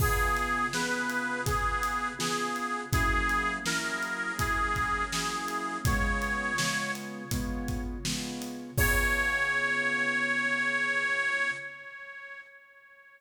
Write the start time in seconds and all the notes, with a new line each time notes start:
0.00 C#3 B3 F4 G#4, kick, crash
0.37 closed hi-hat
0.73 C#3 B3 F4 G#4 B4, snare
1.09 closed hi-hat
1.46 C#3 B3 F4 G#4, kick, closed hi-hat
1.83 closed hi-hat
2.19 C#3 B3 F4 G#4, snare
2.56 closed hi-hat
2.92 F#3 A#3 C#4 E4 G#4, kick, closed hi-hat
3.29 closed hi-hat
3.66 F#3 A#3 C#4 E4 A#4, snare
4.02 closed hi-hat
4.39 F#3 A#3 C#4 E4 G#4, kick, closed hi-hat
4.76 kick, closed hi-hat
5.12 F#3 A#3 C#4 E4 G#4, snare
5.48 closed hi-hat
5.85 C#3 G#3 B3 F4 C#5, kick, closed hi-hat
6.22 closed hi-hat
6.58 C#3 G#3 B3 F4, snare
6.95 closed hi-hat
7.31 C#3 G#3 B3 F4, kick, closed hi-hat
7.68 kick, closed hi-hat
8.05 C#3 G#3 B3 F4, snare
8.42 closed hi-hat
8.77 C#3 B3 F4 G#4 C#5, kick, crash